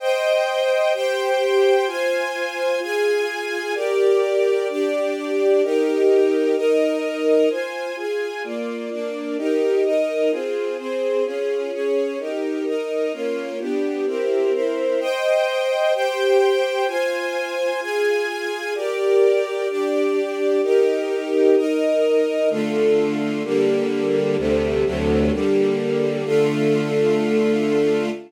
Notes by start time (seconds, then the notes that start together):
0.00 C5 D#5 G5
0.94 G4 C5 G5
1.87 F4 C5 G#5
2.81 F4 G#4 G#5
3.75 G4 A#4 D5
4.69 D4 G4 D5
5.63 D#4 G4 A#4
6.56 D#4 A#4 D#5
7.50 F4 C5 G#5
7.97 F4 G#4 G#5
8.44 A#3 F4 D5
8.90 A#3 D4 D5
9.38 D#4 G4 A#4
9.84 D#4 A#4 D#5
10.31 C4 F4 G#4
10.78 C4 G#4 C5
11.25 C#4 F4 G#4
11.72 C#4 G#4 C#5
12.19 D#4 G4 A#4
12.66 D#4 A#4 D#5
13.13 A#3 C#4 F4
13.59 B3 D4 G4
14.06 C4 E4 G4 A#4
14.53 C4 E4 A#4 C5
15.00 C5 D#5 G5
15.94 G4 C5 G5
16.88 F4 C5 G#5
17.81 F4 G#4 G#5
18.75 G4 A#4 D5
19.69 D4 G4 D5
20.62 D#4 G4 A#4
21.57 D#4 A#4 D#5
22.50 D3 A3 F4
23.44 D3 G3 A#3
24.38 D2 C3 G3 A3
24.85 D2 C3 F#3 A3
25.32 D3 G3 A#3
26.25 D3 A3 F4